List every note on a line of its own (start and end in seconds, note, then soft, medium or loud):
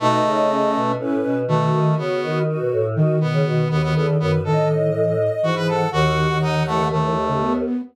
0.00 0.20 B2 loud
0.00 0.92 A3 medium
0.00 0.48 D#4 loud
0.00 0.81 D#5 medium
0.24 0.71 C#3 loud
0.50 0.93 C#4 medium
0.75 0.96 B2 loud
0.99 1.21 A2 loud
0.99 1.43 C#4 medium
0.99 1.38 B4 medium
1.23 1.46 B2 medium
1.48 1.71 B2 loud
1.48 1.94 D#3 loud
1.48 1.95 A3 medium
1.48 2.43 F#4 medium
1.73 1.96 D#3 loud
1.98 2.20 C#3 medium
1.98 2.39 B3 medium
2.22 2.45 D#3 loud
2.46 2.58 D#3 loud
2.46 2.87 F#4 medium
2.59 2.71 B2 medium
2.72 2.95 A2 loud
2.95 4.38 D#3 loud
2.95 3.17 D#3 loud
2.95 3.19 F#4 medium
3.20 3.32 B2 medium
3.20 3.68 B3 medium
3.33 3.45 C#3 loud
3.45 3.66 B2 loud
3.45 3.68 F#4 medium
3.70 3.94 D#2 medium
3.70 3.82 B3 medium
3.70 3.92 F#4 medium
3.83 3.94 B3 medium
3.95 4.16 E2 loud
3.95 4.07 B3 medium
3.95 4.17 A4 medium
4.20 4.43 F#2 loud
4.20 4.32 B3 medium
4.20 4.42 B4 medium
4.44 5.29 A2 loud
4.44 4.90 D#3 loud
4.44 4.68 A4 medium
4.44 5.46 D#5 medium
4.94 5.16 E3 medium
5.43 5.83 G#2 medium
5.43 5.85 E3 medium
5.43 5.55 F#4 medium
5.55 5.67 B4 medium
5.68 5.90 A4 medium
5.68 5.89 F#5 medium
5.92 6.27 D#2 loud
5.92 6.64 D#3 loud
5.92 6.38 F#4 medium
5.92 6.86 F#5 medium
6.30 7.61 D#2 medium
6.42 6.63 D#4 medium
6.66 6.78 E3 medium
6.66 6.88 A3 medium
6.79 6.91 D#3 medium
6.91 7.03 D#3 medium
6.91 7.53 A3 medium
7.03 7.15 E3 medium
7.28 7.40 C#3 medium
7.41 7.82 B3 medium